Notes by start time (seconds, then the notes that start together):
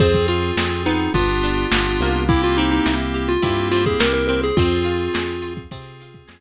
0.00 F2 C4 F4 G#4, kick, closed hi-hat
0.14 kick, closed hi-hat
0.28 F4, closed hi-hat
0.43 closed hi-hat
0.57 F2 C4 F4 G#4, snare
0.71 closed hi-hat
0.86 B3 D#4, closed hi-hat
1.00 closed hi-hat
1.14 G1 B3 D4 F4 G4, kick, closed hi-hat
1.28 closed hi-hat
1.43 D4, closed hi-hat
1.57 closed hi-hat
1.71 G1 B3 D4 F4 G4, snare
1.85 closed hi-hat
2.00 C2 A#3, closed hi-hat
2.15 closed hi-hat
2.29 A#3 C4 E4 G4, kick
2.43 F4, closed hi-hat
2.57 C4 D#4, closed hi-hat
2.71 D#4, closed hi-hat
2.86 C2 E4, snare
3.00 closed hi-hat
3.14 G4, closed hi-hat
3.28 F4, closed hi-hat
3.42 G2 A#3 C4 E4 G4, kick, closed hi-hat
3.57 closed hi-hat
3.71 C4 F4, closed hi-hat
3.85 G#4, kick, closed hi-hat
4.00 C2 A#3 A#4, snare
4.13 A#4, closed hi-hat
4.28 C4 A#4, closed hi-hat
4.43 G#4, closed hi-hat
4.57 F2 C4 F4 G#4, kick, closed hi-hat
4.71 closed hi-hat
4.85 F4, closed hi-hat
5.00 closed hi-hat
5.14 F2 G#4, snare
5.28 closed hi-hat
5.42 F4, closed hi-hat
5.57 kick, closed hi-hat
5.71 C3 C4 F4 G#4, kick, closed hi-hat
5.86 closed hi-hat
6.00 F4, closed hi-hat
6.14 kick, closed hi-hat
6.28 F2 G#4, snare